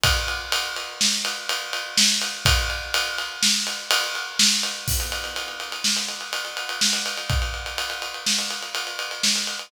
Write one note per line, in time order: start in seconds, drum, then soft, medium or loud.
0.04 kick loud
0.04 ride loud
0.28 ride medium
0.52 ride loud
0.76 ride medium
1.01 snare loud
1.25 ride loud
1.49 ride loud
1.73 ride loud
1.97 snare loud
2.22 ride medium
2.45 kick loud
2.45 ride loud
2.70 ride medium
2.94 ride loud
3.18 ride medium
3.43 snare loud
3.67 ride medium
3.91 ride loud
4.15 ride medium
4.39 snare loud
4.63 ride medium
4.88 kick loud
4.88 crash loud
5.00 ride medium
5.12 ride medium
5.24 ride medium
5.36 ride medium
5.48 ride medium
5.60 ride medium
5.72 ride medium
5.84 snare loud
5.96 ride medium
6.08 ride medium
6.21 ride medium
6.33 ride loud
6.45 ride medium
6.57 ride medium
6.69 ride medium
6.81 snare loud
6.93 ride medium
7.06 ride medium
7.17 ride medium
7.30 kick loud
7.30 ride loud
7.42 ride medium
7.54 ride medium
7.66 ride medium
7.78 ride loud
7.90 ride medium
8.02 ride medium
8.14 ride medium
8.26 snare loud
8.39 ride medium
8.51 ride medium
8.63 ride medium
8.75 ride loud
8.87 ride medium
8.99 ride medium
9.11 ride medium
9.23 snare loud
9.36 ride medium
9.47 ride medium
9.59 ride medium